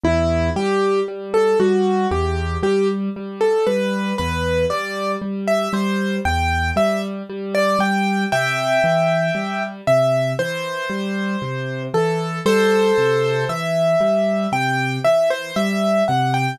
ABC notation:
X:1
M:4/4
L:1/16
Q:1/4=58
K:Em
V:1 name="Acoustic Grand Piano"
E2 G2 z A F2 G2 G z2 A B2 | B2 d2 z e c2 g2 e z2 d g2 | [eg]6 e2 c6 A2 | [Ac]4 e4 g2 e c e2 f g |]
V:2 name="Acoustic Grand Piano" clef=bass
E,,2 G,2 G,2 G,2 E,,2 G,2 G,2 G,2 | E,,2 G,2 G,2 G,2 E,,2 G,2 G,2 G,2 | C,2 E,2 G,2 C,2 E,2 G,2 C,2 E,2 | G,2 C,2 E,2 G,2 C,2 E,2 G,2 C,2 |]